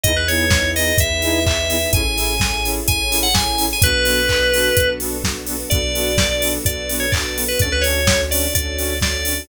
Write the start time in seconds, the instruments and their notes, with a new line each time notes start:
0.03 synth bass 2 E2, lead 2 (sawtooth) B3 D#4 E4 G#4, string ensemble 1 B3 D#4 E4 G#4, electric piano 2 D#5, kick, closed hi-hat
0.16 electric piano 2 B4
0.28 lead 2 (sawtooth) B3 D#4 E4 G#4, electric piano 2 C#5, open hi-hat
0.50 kick, snare
0.76 lead 2 (sawtooth) B3 D#4 E4 G#4, electric piano 2 D#5, open hi-hat
0.98 synth bass 2 E2, electric piano 2 E5, kick, closed hi-hat
1.22 lead 2 (sawtooth) B3 D#4 E4 G#4, open hi-hat
1.46 electric piano 2 E5, kick, clap
1.69 lead 2 (sawtooth) B3 D#4 E4 G#4, open hi-hat
1.93 synth bass 2 A1, string ensemble 1 C#4 E4 G#4 A4, lead 2 (sawtooth) C#4 E4 G#4 A4, electric piano 2 G#5, kick, closed hi-hat
2.17 lead 2 (sawtooth) C#4 E4 G#4 A4, open hi-hat
2.40 kick, snare
2.64 lead 2 (sawtooth) C#4 E4 G#4 A4, open hi-hat
2.88 synth bass 2 A1, electric piano 2 G#5, kick, closed hi-hat
3.11 lead 2 (sawtooth) C#4 E4 G#4 A4, open hi-hat
3.23 electric piano 2 F#5
3.34 electric piano 2 G#5, kick, snare
3.58 lead 2 (sawtooth) C#4 E4 G#4 A4, open hi-hat
3.73 electric piano 2 G#5
3.82 synth bass 2 B1, lead 2 (sawtooth) B3 D4 F#4 A4, string ensemble 1 B3 D4 F#4 A4, electric piano 2 B4, kick, closed hi-hat
4.05 lead 2 (sawtooth) B3 D4 F#4 A4, open hi-hat
4.29 kick, clap
4.53 lead 2 (sawtooth) B3 D4 F#4 A4, open hi-hat
4.77 synth bass 2 B1, kick, closed hi-hat
5.00 lead 2 (sawtooth) B3 D4 F#4 A4, open hi-hat
5.24 kick, snare
5.46 lead 2 (sawtooth) B3 D4 F#4 A4, open hi-hat
5.70 synth bass 2 B1, lead 2 (sawtooth) B3 D4 F#4 A4, string ensemble 1 B3 D4 F#4 A4, electric piano 2 D5, kick, closed hi-hat
5.95 lead 2 (sawtooth) B3 D4 F#4 A4, open hi-hat
6.18 kick, snare
6.42 lead 2 (sawtooth) B3 D4 F#4 A4, open hi-hat
6.65 synth bass 2 B1, electric piano 2 D5, kick, closed hi-hat
6.89 lead 2 (sawtooth) B3 D4 F#4 A4, open hi-hat
7.00 electric piano 2 C#5
7.12 electric piano 2 D5, kick, clap
7.36 lead 2 (sawtooth) B3 D4 F#4 A4, open hi-hat
7.48 electric piano 2 B4
7.59 synth bass 2 D2, lead 2 (sawtooth) C#4 D4 F#4 A4, string ensemble 1 C#4 D4 F#4 A4, electric piano 2 D5, kick, closed hi-hat
7.72 electric piano 2 B4
7.81 lead 2 (sawtooth) C#4 D4 F#4 A4, electric piano 2 C#5, open hi-hat
8.07 kick, snare
8.31 lead 2 (sawtooth) C#4 D4 F#4 A4, electric piano 2 D5, open hi-hat
8.54 synth bass 2 D2, electric piano 2 D5, kick, closed hi-hat
8.78 lead 2 (sawtooth) C#4 D4 F#4 A4, open hi-hat
9.01 electric piano 2 D5, kick, snare
9.25 lead 2 (sawtooth) C#4 D4 F#4 A4, open hi-hat